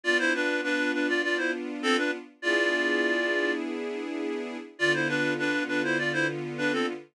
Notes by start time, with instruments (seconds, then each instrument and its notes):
0.03 string ensemble 1 B3 D4 F4, clarinet F4 D5
0.19 clarinet E4 C5
0.34 clarinet D4 B4
0.63 clarinet D4 B4
0.93 clarinet D4 B4
1.08 clarinet F4 D5
1.23 clarinet F4 D5
1.37 clarinet E4 C5
1.83 clarinet C4 A4
1.97 clarinet D4 B4
2.42 string ensemble 1 B3 D4 E4 G#4, clarinet F4 D5
4.79 string ensemble 1 D3 B3 F4, clarinet F4 D5
4.94 clarinet E4 C5
5.08 clarinet D4 B4
5.39 clarinet D4 B4
5.68 clarinet D4 B4
5.84 clarinet E4 C5
5.98 clarinet F4 D5
6.13 clarinet E4 C5
6.58 clarinet D4 B4
6.72 clarinet C4 A4